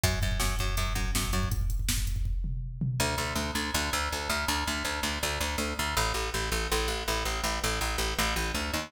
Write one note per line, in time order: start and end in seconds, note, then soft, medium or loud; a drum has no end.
0.03 0.19 F#2 medium
0.03 kick loud
0.03 closed hi-hat medium
0.13 kick medium
0.22 0.38 F#2 medium
0.22 kick medium
0.22 closed hi-hat medium
0.31 kick medium
0.40 0.55 F#2 medium
0.40 kick medium
0.40 snare loud
0.50 kick medium
0.59 0.76 F#2 medium
0.59 kick medium
0.59 closed hi-hat medium
0.68 kick medium
0.77 0.93 F#2 medium
0.77 kick medium
0.77 closed hi-hat medium
0.87 kick medium
0.95 1.11 F#2 medium
0.95 kick medium
0.95 closed hi-hat medium
1.05 kick medium
1.15 1.31 F#2 medium
1.15 kick medium
1.15 snare loud
1.24 kick medium
1.33 1.49 F#2 medium
1.33 kick medium
1.33 closed hi-hat medium
1.43 kick medium
1.51 kick loud
1.51 closed hi-hat medium
1.61 kick medium
1.70 kick medium
1.70 closed hi-hat medium
1.79 kick medium
1.89 kick medium
1.89 snare loud
1.98 kick medium
2.07 kick medium
2.07 closed hi-hat medium
2.16 kick medium
2.25 kick medium
2.44 floor tom medium
2.81 floor tom loud
3.00 3.16 D2 medium
3.18 3.33 D2 medium
3.35 3.51 D2 medium
3.55 3.71 D2 medium
3.74 3.90 D2 medium
3.93 4.09 D2 medium
4.12 4.28 D2 medium
4.29 4.45 D2 medium
4.48 4.64 D2 medium
4.67 4.83 D2 medium
4.85 5.00 D2 medium
5.03 5.19 D2 medium
5.23 5.39 D2 medium
5.41 5.56 D2 medium
5.58 5.74 D2 medium
5.79 5.95 D2 medium
5.97 6.12 A1 medium
6.14 6.30 A1 medium
6.34 6.50 A1 medium
6.52 6.67 A1 medium
6.72 6.87 A1 medium
6.88 7.03 A1 medium
7.08 7.23 A1 medium
7.25 7.41 A1 medium
7.44 7.59 A1 medium
7.64 7.79 A1 medium
7.81 7.97 A1 medium
7.98 8.14 A1 medium
8.19 8.34 A1 medium
8.36 8.52 A1 medium
8.54 8.71 D2 medium
8.73 8.90 D#2 medium